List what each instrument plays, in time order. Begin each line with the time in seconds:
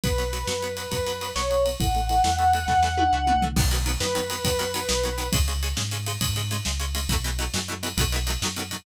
0.04 synth bass 1 B1, acoustic guitar (steel) F#3 B3, lead 1 (square) B4, kick, ride
0.18 acoustic guitar (steel) F#3 B3, ride
0.33 acoustic guitar (steel) F#3 B3, ride
0.47 synth bass 1 F#2, acoustic guitar (steel) F#3 B3, snare
0.62 acoustic guitar (steel) F#3 B3, ride
0.77 acoustic guitar (steel) F#3 B3, ride
0.91 synth bass 1 F#2, acoustic guitar (steel) F#3 B3, kick, ride
1.06 acoustic guitar (steel) F#3 B3, ride
1.21 acoustic guitar (steel) F#3 B3, ride
1.35 synth bass 1 B1, acoustic guitar (steel) F#3 B3, lead 1 (square) C#5, snare
1.50 acoustic guitar (steel) F#3 B3, ride
1.65 acoustic guitar (steel) F#3 B3, ride
1.80 synth bass 1 A1, acoustic guitar (steel) E3 A3, lead 1 (square) F#5, kick, ride
1.95 acoustic guitar (steel) E3 A3, ride
2.09 acoustic guitar (steel) E3 A3, ride
2.24 synth bass 1 E2, acoustic guitar (steel) E3 A3, snare
2.39 acoustic guitar (steel) E3 A3, ride
2.53 acoustic guitar (steel) E3 A3, ride
2.67 synth bass 1 E2, acoustic guitar (steel) E3 A3, kick, snare
2.83 acoustic guitar (steel) E3 A3, snare
2.97 acoustic guitar (steel) E3 A3, high tom
3.12 synth bass 1 C#2, acoustic guitar (steel) E3 A3
3.27 acoustic guitar (steel) E3 A3, mid tom
3.35 synth bass 1 C2
3.42 acoustic guitar (steel) E3 A3, floor tom
3.56 synth bass 1 B1, acoustic guitar (steel) D#3 F#3 B3, kick, crash
3.71 acoustic guitar (steel) D#3 F#3 B3, ride
3.86 acoustic guitar (steel) D#3 F#3 B3, ride
4.00 synth bass 1 F#2, acoustic guitar (steel) D#3 F#3 B3, lead 1 (square) B4, snare
4.15 acoustic guitar (steel) D#3 F#3 B3, ride
4.30 acoustic guitar (steel) D#3 F#3 B3, ride
4.44 synth bass 1 F#2, acoustic guitar (steel) D#3 F#3 B3, kick, ride
4.59 acoustic guitar (steel) D#3 F#3 B3, ride
4.74 acoustic guitar (steel) D#3 F#3 B3, ride
4.88 synth bass 1 B1, acoustic guitar (steel) D#3 F#3 B3, snare
5.03 acoustic guitar (steel) D#3 F#3 B3, ride
5.18 acoustic guitar (steel) D#3 F#3 B3, ride
5.32 synth bass 1 C#2, acoustic guitar (steel) C#3 G#3, kick, ride
5.48 acoustic guitar (steel) C#3 G#3, ride
5.63 acoustic guitar (steel) C#3 G#3, ride
5.77 synth bass 1 G#2, acoustic guitar (steel) C#3 G#3, snare
5.91 acoustic guitar (steel) C#3 G#3, ride
6.06 acoustic guitar (steel) C#3 G#3, ride
6.21 synth bass 1 G#2, acoustic guitar (steel) C#3 G#3, kick, ride
6.36 acoustic guitar (steel) C#3 G#3, ride
6.51 acoustic guitar (steel) C#3 G#3, ride
6.65 synth bass 1 C#2, acoustic guitar (steel) C#3 G#3, snare
6.80 acoustic guitar (steel) C#3 G#3, ride
6.95 acoustic guitar (steel) C#3 G#3, ride
7.08 synth bass 1 B1, acoustic guitar (steel) B2 E3 F#3, kick, ride
7.13 acoustic guitar (steel) A3
7.24 acoustic guitar (steel) B2 E3 F#3 A3, ride
7.39 acoustic guitar (steel) B2 E3 F#3 A3, ride
7.54 synth bass 1 F#2, acoustic guitar (steel) B2 E3 F#3 A3, snare
7.68 acoustic guitar (steel) B2 E3 F#3 A3
7.83 acoustic guitar (steel) B2 E3 F#3 A3, ride
7.97 synth bass 1 B1, acoustic guitar (steel) B2 D#3 F#3 A3, kick, ride
8.12 acoustic guitar (steel) B2 D#3 F#3 A3, ride
8.27 acoustic guitar (steel) B2 D#3 F#3 A3, ride
8.41 synth bass 1 F#2, acoustic guitar (steel) B2 D#3 F#3, snare
8.46 acoustic guitar (steel) A3
8.56 acoustic guitar (steel) B2 D#3 F#3 A3, ride
8.71 acoustic guitar (steel) B2 D#3 F#3 A3, ride